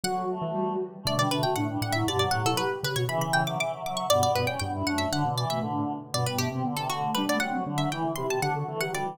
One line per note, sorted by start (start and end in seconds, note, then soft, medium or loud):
0.04 0.26 D3 medium
0.04 0.26 F#3 loud
0.04 0.87 F#4 medium
0.04 0.29 F#4 loud
0.04 0.78 F#5 medium
0.30 0.73 A3 medium
0.42 0.53 E3 medium
0.54 0.76 G3 medium
1.03 1.46 B2 loud
1.03 1.46 D3 loud
1.03 1.14 A3 loud
1.03 1.26 D4 medium
1.03 1.18 D5 medium
1.18 1.28 G3 loud
1.18 1.30 D5 medium
1.31 1.55 A3 medium
1.31 1.43 D4 medium
1.31 1.42 B4 medium
1.43 1.55 F#4 medium
1.43 1.54 G5 medium
1.56 1.77 A2 medium
1.56 1.67 A3 medium
1.56 1.78 D4 medium
1.56 1.80 F#5 medium
1.69 1.81 G3 medium
1.81 2.04 A2 loud
1.81 1.93 G3 loud
1.81 1.93 D4 medium
1.81 1.93 F#5 medium
1.92 2.05 F#3 medium
1.92 2.07 E4 medium
1.92 2.03 E5 medium
2.06 2.30 G2 medium
2.06 2.30 B2 loud
2.06 2.17 D3 loud
2.06 2.29 G4 medium
2.06 2.19 D5 medium
2.19 2.64 F#3 loud
2.19 2.31 D5 medium
2.31 2.43 A2 loud
2.31 2.44 G4 medium
2.31 2.42 F#5 medium
2.45 2.55 B2 medium
2.45 2.57 E4 medium
2.45 2.58 A4 medium
2.57 2.80 G4 medium
2.57 2.79 B4 medium
2.83 2.95 C#3 loud
2.83 2.95 G4 medium
2.83 2.96 B4 medium
2.96 3.08 B2 loud
2.96 3.08 F#4 medium
2.96 3.06 C#5 medium
3.08 3.57 C#3 loud
3.08 3.42 E3 loud
3.08 3.57 E3 loud
3.08 3.30 E5 medium
3.08 3.21 B5 medium
3.21 3.32 B5 medium
3.33 3.45 E5 medium
3.33 3.44 G5 medium
3.46 3.58 F#3 medium
3.46 3.56 E5 medium
3.46 3.59 D6 medium
3.59 3.72 E3 medium
3.59 3.81 E5 medium
3.59 3.81 D6 medium
3.73 3.82 F#3 loud
3.83 4.06 F#3 loud
3.83 3.97 E5 medium
3.83 3.98 D6 medium
3.97 4.09 E5 medium
3.97 4.09 C#6 medium
4.10 4.55 G2 medium
4.10 4.55 B2 loud
4.10 4.45 B3 loud
4.10 4.21 D5 medium
4.10 4.31 D5 medium
4.23 4.35 D5 medium
4.35 4.47 B4 medium
4.35 4.48 D5 medium
4.47 4.60 C#4 medium
4.47 4.59 C#5 medium
4.47 4.59 G5 medium
4.59 4.83 G2 loud
4.59 4.72 B3 medium
4.59 5.05 D4 medium
4.59 4.84 G5 medium
4.73 4.85 E4 loud
4.86 5.07 F#2 loud
4.86 5.10 A3 medium
4.86 4.98 F#5 medium
4.98 5.08 E5 medium
5.11 5.24 D3 loud
5.11 5.35 D3 loud
5.11 5.22 D4 medium
5.11 5.33 F#5 medium
5.25 5.45 B2 loud
5.25 5.37 B3 medium
5.37 5.59 E3 medium
5.37 5.49 D5 medium
5.50 5.62 B2 medium
5.50 5.62 A3 medium
5.50 5.72 E5 medium
5.61 5.85 A2 medium
5.61 5.92 D3 medium
5.61 5.97 D4 medium
6.13 6.51 G2 medium
6.13 6.51 B2 loud
6.13 6.24 B3 medium
6.13 6.50 B3 medium
6.13 6.26 D5 medium
6.26 6.37 G3 medium
6.26 6.38 B4 medium
6.38 6.48 A3 medium
6.38 6.75 G4 medium
6.51 6.63 C3 loud
6.51 6.62 C4 medium
6.51 6.64 C4 medium
6.64 7.11 D3 medium
6.64 6.75 D3 medium
6.64 6.74 B3 medium
6.77 6.88 C3 medium
6.77 6.88 B3 medium
6.77 6.88 A4 medium
6.89 7.11 D3 medium
6.89 7.15 A3 medium
6.89 7.13 F#4 medium
7.14 7.27 G3 loud
7.14 7.26 D4 loud
7.14 7.51 D4 medium
7.14 7.25 B4 medium
7.27 7.39 A3 medium
7.27 7.38 B3 medium
7.27 7.41 D5 medium
7.40 7.65 F#3 medium
7.40 7.52 C4 medium
7.40 7.76 F#5 medium
7.51 7.64 C4 medium
7.51 7.64 F#4 medium
7.66 7.89 D3 medium
7.66 7.80 D3 medium
7.66 7.77 D4 medium
7.77 7.90 F#3 loud
7.77 7.88 D4 medium
7.77 7.89 E5 medium
7.91 8.12 E3 loud
7.91 8.04 E3 medium
7.91 8.13 E4 medium
7.91 8.15 G5 medium
8.04 8.15 D3 medium
8.15 8.30 C3 medium
8.15 8.26 E4 loud
8.15 8.49 G4 medium
8.15 8.26 C6 medium
8.30 8.40 B2 medium
8.30 8.40 C4 medium
8.30 8.41 A5 medium
8.41 8.64 D3 medium
8.41 8.54 D4 medium
8.41 8.75 F#5 medium
8.55 8.66 F#4 medium
8.55 8.66 A4 medium
8.67 8.92 E3 loud
8.67 8.80 A3 medium
8.67 8.79 A4 medium
8.81 8.91 F#3 medium
8.81 8.91 G4 medium
8.81 8.92 F#5 medium
8.92 9.04 D3 medium
8.92 9.16 G3 loud
8.92 9.13 F#4 medium
8.92 9.15 D5 medium
9.06 9.17 E3 loud